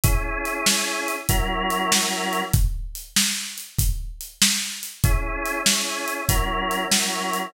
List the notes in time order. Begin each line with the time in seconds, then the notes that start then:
0.04 C#4 E4 G#4, kick, closed hi-hat
0.45 closed hi-hat
0.66 snare
1.08 closed hi-hat
1.29 F#3 C#4 E4 A#4, kick, closed hi-hat
1.70 closed hi-hat
1.92 snare
2.33 closed hi-hat
2.53 kick, closed hi-hat
2.95 closed hi-hat
3.16 snare
3.58 closed hi-hat
3.79 kick, closed hi-hat
4.21 closed hi-hat
4.42 snare
4.83 closed hi-hat
5.04 C#4 E4 G#4, kick, closed hi-hat
5.45 closed hi-hat
5.66 C#4 E4 G#4, snare
6.08 closed hi-hat
6.29 F#3 C#4 E4 A#4, kick, closed hi-hat
6.71 closed hi-hat
6.91 F#3 C#4 E4 A#4, snare
7.33 closed hi-hat